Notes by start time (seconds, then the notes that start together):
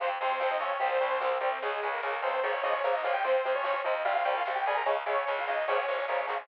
0.00 F2 C3 F3 C4 C5, kick, closed hi-hat
0.10 kick
0.20 F2 C3 F3 C4 C5, kick, closed hi-hat
0.30 kick
0.40 F2 C3 F3 C4 C5, kick, snare
0.51 D#4 D#5, kick
0.59 F2 C3 F3 C#4 C#5, kick, closed hi-hat
0.71 kick
0.79 C2 C3 G3 C4 C5, kick, closed hi-hat
0.91 C4 C5, kick
1.01 C2 C3 G3, kick, closed hi-hat
1.11 kick
1.20 C2 C3 G3 C4, kick, snare
1.32 kick
1.41 C2 C3 G3 C4, kick, closed hi-hat
1.52 C3 C4, kick
1.62 C#2 C#3 G#3 G#4, kick, closed hi-hat
1.72 kick
1.83 C#2 C#3 G#3, kick, closed hi-hat
1.92 A#3 A#4, kick
2.02 C#2 C#3 G#3, kick, snare
2.13 kick
2.22 C#2 C#3 G#3 C4 C5, kick, closed hi-hat
2.33 kick
2.43 A#1 C#3 F3 A#3 C#4 C#5, kick, closed hi-hat
2.53 C#4 C#5, kick
2.63 A#1 C#3 F3 A#3 D#4 D#5, kick, closed hi-hat
2.73 C#4 C#5, kick
2.84 A#1 C#3 F3 A#3, kick, snare
2.94 D#4 D#5, kick
3.03 A#1 C#3 F3 A#3 F4 F5, kick, closed hi-hat
3.13 G4 G5, kick
3.24 F2 C3 F3 C4 C5, kick, closed hi-hat
3.35 kick
3.44 F2 C3 F3, kick, closed hi-hat
3.55 C#4 C#5, kick
3.64 F2 C3 F3, kick, snare
3.75 kick
3.84 F2 C3 F3 D#4 D#5, kick, closed hi-hat
3.95 kick
4.05 C2 C3 G3 F4 F5, kick, closed hi-hat
4.15 F4 F5, kick
4.25 C2 C3 G3 G4 G5, kick, closed hi-hat
4.36 F4 F5, kick
4.45 C2 C3 G3, kick, snare
4.55 G4 G5, kick
4.66 C2 C3 G3 G#4 G#5, kick, closed hi-hat
4.76 A#4 A#5, kick
4.86 C#2 C#3 G#3 C#4 C#5, kick, closed hi-hat
4.97 kick
5.06 C#2 C#3 G#3 C#4 C#5, kick, closed hi-hat
5.17 kick
5.26 C#2 C#3 G#3 C#4 C#5, kick, snare
5.37 F4 F5, kick
5.47 C#2 C#3 G#3 D#4 D#5, kick, closed hi-hat
5.58 kick
5.67 A#1 C#3 F3 A#3 C#4 C#5, kick, closed hi-hat
5.77 C#4 C#5, kick
5.88 A#1 C#3 F3 A#3, kick, closed hi-hat
5.98 kick
6.08 A#1 C#3 F3 A#3 C#4, kick, snare
6.27 A#1 C#3 F3 A#3 C#4, snare
6.39 C#3 C#4